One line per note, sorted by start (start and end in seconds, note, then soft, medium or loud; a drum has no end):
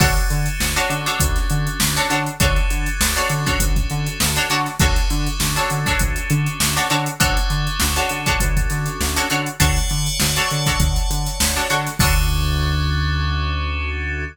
0.00 0.18 D2 medium
0.00 2.16 C#4 medium
0.00 0.49 D4 medium
0.00 2.16 D4 medium
0.00 2.16 F#4 medium
0.00 0.49 F#4 medium
0.00 2.16 A4 medium
0.00 0.49 A4 loud
0.00 0.49 C#5 medium
0.00 kick loud
0.00 crash loud
0.17 closed hi-hat medium
0.30 0.48 D3 medium
0.30 closed hi-hat medium
0.46 closed hi-hat medium
0.60 0.78 D2 medium
0.60 snare loud
0.76 1.00 D4 medium
0.76 1.00 F#4 medium
0.76 1.00 A4 medium
0.76 1.00 C#5 medium
0.76 closed hi-hat medium
0.90 1.07 D3 medium
0.90 closed hi-hat medium
1.06 1.53 D4 medium
1.06 1.53 F#4 medium
1.06 1.53 A4 medium
1.06 1.53 C#5 medium
1.06 snare soft
1.06 closed hi-hat medium
1.20 1.38 D2 medium
1.20 kick medium
1.20 closed hi-hat loud
1.36 snare soft
1.36 closed hi-hat medium
1.50 1.68 D3 medium
1.50 closed hi-hat medium
1.67 closed hi-hat medium
1.80 1.99 D2 medium
1.80 snare loud
1.96 2.07 D4 medium
1.96 2.07 F#4 medium
1.96 2.07 A4 medium
1.96 2.07 C#5 medium
1.96 snare soft
1.96 closed hi-hat medium
2.10 2.29 D3 medium
2.10 2.34 D4 medium
2.10 2.34 F#4 medium
2.10 2.34 A4 medium
2.10 2.34 C#5 medium
2.10 closed hi-hat medium
2.26 closed hi-hat medium
2.40 2.58 D2 medium
2.40 4.56 C#4 medium
2.40 4.56 D4 medium
2.40 2.89 D4 medium
2.40 4.56 F#4 medium
2.40 2.89 F#4 medium
2.40 4.56 A4 medium
2.40 2.89 A4 medium
2.40 2.89 C#5 medium
2.40 kick loud
2.40 closed hi-hat loud
2.56 closed hi-hat medium
2.70 2.88 D3 medium
2.70 closed hi-hat medium
2.86 closed hi-hat medium
3.00 3.18 D2 medium
3.00 snare loud
3.16 3.40 D4 medium
3.16 3.40 F#4 medium
3.16 3.40 A4 medium
3.16 3.40 C#5 medium
3.16 closed hi-hat medium
3.29 3.48 D3 medium
3.29 closed hi-hat medium
3.46 3.93 D4 medium
3.46 3.93 F#4 medium
3.46 3.93 A4 medium
3.46 3.93 C#5 medium
3.46 kick medium
3.46 snare soft
3.46 closed hi-hat medium
3.60 3.78 D2 medium
3.60 kick medium
3.60 closed hi-hat loud
3.76 kick medium
3.76 closed hi-hat medium
3.90 4.08 D3 medium
3.90 closed hi-hat medium
4.07 closed hi-hat medium
4.20 4.38 D2 medium
4.20 snare loud
4.36 4.47 D4 medium
4.36 4.47 F#4 medium
4.36 4.47 A4 medium
4.36 4.47 C#5 medium
4.36 closed hi-hat medium
4.50 4.68 D3 medium
4.50 4.75 D4 medium
4.50 4.75 F#4 medium
4.50 4.75 A4 medium
4.50 4.75 C#5 medium
4.50 snare soft
4.50 closed hi-hat medium
4.66 snare soft
4.66 closed hi-hat medium
4.79 4.99 D2 medium
4.79 6.97 C#4 medium
4.79 6.97 D4 medium
4.79 5.29 D4 medium
4.79 6.97 F#4 medium
4.79 5.29 F#4 medium
4.79 6.97 A4 medium
4.79 5.29 A4 medium
4.79 5.29 C#5 medium
4.79 kick loud
4.79 closed hi-hat medium
4.96 snare soft
4.96 closed hi-hat medium
5.10 5.28 D3 medium
5.10 snare soft
5.10 closed hi-hat medium
5.26 closed hi-hat medium
5.40 5.58 D2 medium
5.40 snare loud
5.56 5.79 D4 medium
5.56 5.79 F#4 medium
5.56 5.79 A4 medium
5.56 5.79 C#5 medium
5.56 closed hi-hat medium
5.70 5.88 D3 medium
5.70 closed hi-hat medium
5.86 6.33 D4 medium
5.86 6.33 F#4 medium
5.86 6.33 A4 medium
5.86 6.33 C#5 medium
5.86 kick medium
5.86 snare soft
5.86 closed hi-hat medium
5.99 6.18 D2 medium
5.99 kick medium
5.99 closed hi-hat loud
6.16 closed hi-hat medium
6.30 6.48 D3 medium
6.30 closed hi-hat medium
6.46 closed hi-hat medium
6.60 6.78 D2 medium
6.60 snare loud
6.76 6.87 D4 medium
6.76 6.87 F#4 medium
6.76 6.87 A4 medium
6.76 6.87 C#5 medium
6.76 closed hi-hat medium
6.90 7.08 D3 medium
6.90 7.15 D4 medium
6.90 7.15 F#4 medium
6.90 7.15 A4 medium
6.90 7.15 C#5 medium
6.90 closed hi-hat medium
7.06 closed hi-hat medium
7.20 7.38 D2 medium
7.20 9.37 C#4 medium
7.20 7.69 D4 medium
7.20 9.37 D4 medium
7.20 9.37 F#4 medium
7.20 7.69 F#4 medium
7.20 9.37 A4 medium
7.20 7.69 A4 medium
7.20 7.69 C#5 loud
7.20 kick loud
7.20 closed hi-hat loud
7.37 closed hi-hat medium
7.50 7.68 D3 medium
7.50 closed hi-hat medium
7.67 closed hi-hat medium
7.80 7.99 D2 medium
7.80 snare loud
7.96 8.20 D4 medium
7.96 8.20 F#4 medium
7.96 8.20 A4 medium
7.96 8.20 C#5 medium
7.96 closed hi-hat medium
8.09 8.28 D3 medium
8.09 closed hi-hat medium
8.26 8.73 D4 medium
8.26 8.73 F#4 medium
8.26 8.73 A4 medium
8.26 8.73 C#5 medium
8.26 kick medium
8.26 closed hi-hat medium
8.40 8.58 D2 medium
8.40 kick medium
8.40 closed hi-hat loud
8.57 kick medium
8.57 closed hi-hat medium
8.70 8.88 D3 medium
8.70 snare soft
8.70 closed hi-hat medium
8.86 closed hi-hat medium
9.01 9.19 D2 medium
9.01 snare medium
9.16 9.27 D4 medium
9.16 9.27 F#4 medium
9.16 9.27 A4 medium
9.16 9.27 C#5 medium
9.16 closed hi-hat medium
9.30 9.49 D3 medium
9.30 9.55 D4 medium
9.30 9.55 F#4 medium
9.30 9.55 A4 medium
9.30 9.55 C#5 medium
9.30 closed hi-hat medium
9.46 closed hi-hat medium
9.60 9.79 D2 medium
9.60 10.09 D4 medium
9.60 10.09 F#4 medium
9.60 10.09 A4 medium
9.60 11.77 C#5 medium
9.60 10.09 C#5 medium
9.60 11.77 D5 medium
9.60 11.77 F#5 medium
9.60 11.77 A5 medium
9.60 kick medium
9.60 closed hi-hat loud
9.76 snare soft
9.76 closed hi-hat medium
9.90 10.09 D3 medium
9.90 closed hi-hat medium
10.06 closed hi-hat medium
10.20 10.38 D2 medium
10.20 snare loud
10.36 10.60 D4 medium
10.36 10.60 F#4 medium
10.36 10.60 A4 medium
10.36 10.60 C#5 medium
10.36 closed hi-hat medium
10.51 10.69 D3 medium
10.51 closed hi-hat medium
10.66 11.13 D4 medium
10.66 11.13 F#4 medium
10.66 11.13 A4 medium
10.66 11.13 C#5 medium
10.66 kick medium
10.66 closed hi-hat medium
10.80 10.98 D2 medium
10.80 kick medium
10.80 closed hi-hat medium
10.96 closed hi-hat medium
11.10 11.28 D3 medium
11.10 closed hi-hat medium
11.26 closed hi-hat medium
11.40 11.58 D2 medium
11.40 snare loud
11.56 11.67 D4 medium
11.56 11.67 F#4 medium
11.56 11.67 A4 medium
11.56 11.67 C#5 medium
11.56 closed hi-hat medium
11.70 11.88 D3 medium
11.70 11.94 D4 medium
11.70 11.94 F#4 medium
11.70 11.94 A4 medium
11.70 11.94 C#5 medium
11.70 snare soft
11.70 closed hi-hat medium
11.86 snare soft
11.86 closed hi-hat medium
11.99 14.25 D2 loud
11.99 14.24 C#4 loud
11.99 14.24 D4 loud
11.99 14.24 D4 medium
11.99 14.24 F#4 loud
11.99 14.24 A4 loud
11.99 14.24 A4 medium
11.99 14.24 C#5 loud
11.99 kick loud
11.99 crash loud